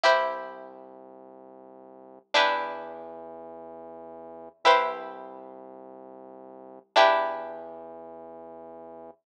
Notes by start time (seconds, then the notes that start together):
0.03 C2 E4 G4 B4 C5
2.34 E2 D4 E4 G4 B4
4.64 C2 E4 G4 B4 C5
6.96 E2 D4 E4 G4 B4